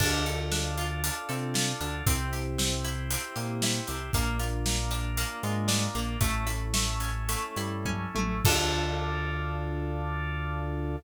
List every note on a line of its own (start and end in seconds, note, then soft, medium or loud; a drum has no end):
0.00 1.10 D2 loud
0.00 0.23 D4 loud
0.00 0.51 D4 medium
0.00 2.05 D4 medium
0.00 2.05 F4 medium
0.00 2.05 A4 medium
0.00 kick medium
0.00 crash medium
0.26 1.28 A4 medium
0.26 closed hi-hat medium
0.52 1.03 D4 medium
0.52 snare medium
0.78 1.54 F4 medium
0.78 closed hi-hat medium
1.04 1.80 D4 medium
1.04 closed hi-hat medium
1.29 1.73 C3 medium
1.29 1.73 C4 medium
1.29 2.02 A4 medium
1.29 closed hi-hat medium
1.54 2.03 F4 medium
1.54 snare medium
1.80 2.02 D2 medium
1.80 2.03 D3 medium
1.80 2.05 D4 medium
1.80 closed hi-hat medium
2.06 3.17 C2 loud
2.06 4.11 C4 medium
2.06 2.58 C4 medium
2.06 2.30 C4 loud
2.06 4.11 E4 medium
2.06 4.11 G4 medium
2.06 kick medium
2.06 closed hi-hat medium
2.33 3.35 G4 medium
2.33 closed hi-hat medium
2.58 3.10 C4 medium
2.58 snare medium
2.84 3.63 E4 medium
2.84 closed hi-hat medium
3.10 3.87 C4 medium
3.10 closed hi-hat medium
3.36 3.80 A#2 medium
3.36 3.80 A#3 medium
3.36 4.09 G4 medium
3.36 closed hi-hat medium
3.62 4.12 E4 medium
3.62 snare medium
3.87 4.10 C2 medium
3.87 4.11 C3 medium
3.87 4.12 C4 medium
3.87 closed hi-hat medium
4.13 5.24 A#1 loud
4.13 4.37 A#3 loud
4.13 4.66 A#3 medium
4.13 6.20 A#3 medium
4.13 6.20 D4 medium
4.13 6.20 F4 medium
4.13 kick medium
4.13 closed hi-hat medium
4.39 5.43 F4 medium
4.39 closed hi-hat medium
4.66 5.17 A#3 medium
4.66 snare medium
4.91 5.67 D4 medium
4.91 closed hi-hat medium
5.17 5.95 A#3 medium
5.17 closed hi-hat medium
5.43 5.87 G#2 loud
5.43 5.87 G#3 loud
5.43 6.17 F4 medium
5.43 closed hi-hat medium
5.68 6.17 D4 medium
5.68 snare medium
5.95 6.17 A#1 loud
5.95 6.17 A#3 medium
5.95 6.20 A#3 medium
5.95 closed hi-hat medium
6.20 7.35 A1 loud
6.20 8.43 A3 medium
6.20 6.44 A3 loud
6.20 6.73 A3 medium
6.20 8.43 C#4 medium
6.20 8.43 E4 medium
6.20 kick medium
6.20 closed hi-hat medium
6.47 7.57 E4 medium
6.47 closed hi-hat medium
6.74 7.28 A3 medium
6.74 snare loud
7.00 7.85 C#4 medium
7.00 closed hi-hat medium
7.29 8.15 A3 medium
7.29 closed hi-hat medium
7.56 8.06 G2 medium
7.56 8.06 G3 medium
7.56 8.41 E4 medium
7.56 closed hi-hat medium
7.85 8.42 C#4 medium
7.85 kick medium
7.85 high tom medium
8.15 8.41 A1 medium
8.15 8.40 A3 medium
8.15 8.44 A3 medium
8.15 high tom medium
8.45 10.96 D2 loud
8.45 10.96 D4 loud
8.45 10.96 F4 medium
8.45 10.96 A4 medium
8.45 10.96 A4 loud
8.45 kick loud
8.45 crash loud